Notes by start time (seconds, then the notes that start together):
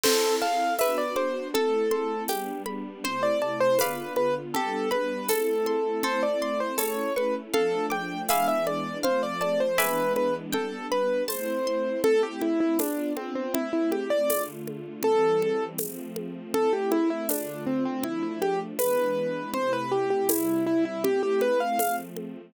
0.04 C4 E4 A4 C5, crash, low conga
0.42 F5 A5, high conga
0.79 B3 D4 F#4 B4 E5, tambourine, high conga
0.98 D5
1.16 C5 D6, high conga
1.54 A3 C4 E4 A4, low conga
1.91 C6, high conga
2.28 G3 B3 D4 G4, tambourine, high conga
2.66 B5, high conga
3.04 C3 A3 E4 C5, low conga
3.23 D5
3.42 D5 A5
3.60 C5
3.79 D3 B3 F4 B4 D5 F5 B5, tambourine, high conga
4.16 B4, high conga
4.54 G3 B3 D4 G4 A4, low conga
4.91 B4 B5, high conga
5.29 A3 C4 E4 A4, tambourine, high conga
5.66 C6, high conga
6.03 A3 C4 E4 A4 C5, low conga
6.23 D5
6.42 D5 C6
6.60 C5
6.78 A3 C#4 E4 A4 C#5, tambourine, high conga
7.16 B4 C#6, high conga
7.54 F3 A3 D4 A4 F5, low conga
7.90 G5 D6, high conga
8.29 E3 G#3 B3 D4 E5 F5 G#5 B5 D6, tambourine, high conga
8.48 E5
8.67 D5, high conga
9.03 F3 A3 C4 C5 F5, low conga
9.23 D5
9.41 D5 A5, high conga
9.60 C5
9.78 E3 G#3 B3 D4 B4 E5 G#5 B5 D6, tambourine, high conga
10.16 B4, high conga
10.53 G3 B3 D4 A4 G5, low conga
10.92 B4 B5, low conga
11.28 A3 C4 E4 C5 A5, tambourine, high conga
11.67 C6
12.04 A3 C4 E4 A4, low conga
12.23 G4
12.41 E4, high conga
12.60 E4
12.79 B3 D4 F4, tambourine, high conga
13.17 C4, high conga
13.35 C4
13.54 A3 C4 E4, low conga
13.73 E4
13.92 G4, high conga
14.10 D5
14.29 D3 A3 F4, tambourine, high conga
14.68 high conga
15.03 E3 G3 C4 A4, low conga
15.42 high conga
15.78 F3 A3 C4, tambourine, high conga
16.16 high conga
16.54 A3 C4 E4 A4, low conga
16.73 G4
16.92 E4, high conga
17.10 E4
17.29 D3 A3 D4 F4, tambourine, high conga
17.66 C4
17.85 C4
18.03 F3 A3 D4 E4, low conga
18.23 E4
18.42 G4, high conga
18.79 E3 G#3 B3 D4 B4, tambourine, high conga
19.54 C3 A3 E4 C5, low conga
19.73 B4
19.92 G4
20.10 G4
20.29 C3 G3 E4, tambourine, high conga
20.66 E4
20.85 E4
21.04 A3 C4 E4 G4, low conga
21.23 G4
21.41 B4, high conga
21.60 F5
21.79 F3 A3 C4, tambourine, high conga
22.17 high conga